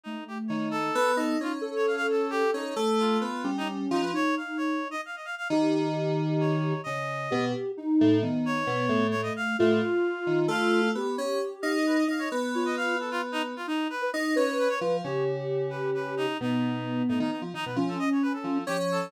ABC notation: X:1
M:6/8
L:1/16
Q:3/8=88
K:none
V:1 name="Ocarina"
A,8 B,4 | ^D2 A10 | z6 ^C6 | ^D8 z4 |
G12 | z4 G4 ^D4 | B,8 A,4 | F12 |
G8 z4 | z2 F4 z6 | ^D3 B z2 B6 | G12 |
B,10 z2 | ^C8 F,4 |]
V:2 name="Clarinet"
^D2 G z ^c2 A4 A2 | F z2 ^c f f A2 G2 ^D2 | z2 F5 ^D z2 D B | ^c2 f2 c3 ^d f d f f |
z8 ^c4 | ^d6 z6 | z2 ^c6 c ^d f2 | f8 f4 |
z6 f ^d B d f ^c | z2 ^c ^d f2 A F z ^D z F | ^D2 B2 z2 ^c2 B c z2 | ^c2 z4 B2 B2 ^D2 |
^D6 D D D z D B | z A ^d ^c B A3 G z A2 |]
V:3 name="Electric Piano 2"
z4 ^D,4 B,2 ^D2 | ^C10 C2 | A,4 B,2 G,4 F,2 | z12 |
^D,12 | ^C,4 B,,2 z4 A,,2 | ^D,4 B,,2 A,,4 z2 | A,,2 z4 ^D,2 A,4 |
B,2 ^C2 z2 ^D4 D2 | B,12 | z4 ^D2 ^C3 z F,2 | ^C,12 |
B,,6 A,, ^D, z F, D, B,, | F,2 z4 F,2 ^C4 |]